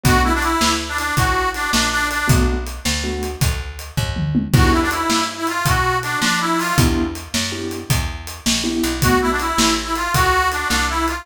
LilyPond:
<<
  \new Staff \with { instrumentName = "Harmonica" } { \time 12/8 \key b \minor \tempo 4. = 107 fis'8 e'16 d'16 e'4 r16 d'16 d'8 fis'4 d'8 d'8 d'8 d'8 | r1. | fis'8 e'16 d'16 e'4 r16 e'16 eis'8 fis'4 d'8 d'8 e'8 eis'8 | r1. |
fis'8 e'16 d'16 e'4 r16 e'16 eis'8 fis'4 d'8 d'8 e'8 f'8 | }
  \new Staff \with { instrumentName = "Acoustic Grand Piano" } { \time 12/8 \key b \minor <a b d' fis'>1. | <a b d' fis'>2 <a b d' fis'>1 | <b d' e' g'>1. | <b d' e' g'>2 <b d' e' g'>2. <b d' e' g'>4 |
<a b d' fis'>1. | }
  \new Staff \with { instrumentName = "Electric Bass (finger)" } { \clef bass \time 12/8 \key b \minor b,,4. d,4. a,,4. ais,,4. | b,,4. d,4. d,4. dis,4. | e,4. g,4. b,4. f4. | e,4. fis,4. e,4. ais,,4 b,,8~ |
b,,4. a,,4. d,4. c,4. | }
  \new DrumStaff \with { instrumentName = "Drums" } \drummode { \time 12/8 <hh bd>4 hh8 sn4 hh8 <hh bd>4 hh8 sn4 hh8 | <hh bd>4 hh8 sn4 hh8 <hh bd>4 hh8 <bd tomfh>8 toml8 tommh8 | <cymc bd>4 hh8 sn4 hh8 <hh bd>4 hh8 sn4 hho8 | <hh bd>4 hh8 sn4 hh8 <hh bd>4 hh8 sn4 hh8 |
<hh bd>4 hh8 sn4 hh8 <hh bd>4 hh8 sn4 hh8 | }
>>